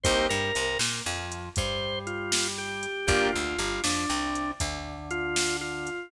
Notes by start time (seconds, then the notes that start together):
0.03 C2 A#3 C4 D#4 G4 C5, kick, closed hi-hat
0.29 G2 G3 A#4
0.55 C2 C3, closed hi-hat
0.79 A#2 A#3, snare
1.06 F2 F3
1.32 closed hi-hat
1.56 G2 G3 C5, kick, closed hi-hat
2.07 F4, closed hi-hat
2.32 snare
2.58 G4
2.83 closed hi-hat
3.07 G1 A#3 D4 F4 G4, kick, closed hi-hat
3.32 D2 D3 F4
3.59 G1 G3, closed hi-hat
3.84 F2 F3 D4, snare
4.09 C2 C3
4.35 closed hi-hat
4.60 D2 D3, kick, closed hi-hat
5.11 F4, closed hi-hat
5.36 snare
5.61 F4
5.87 closed hi-hat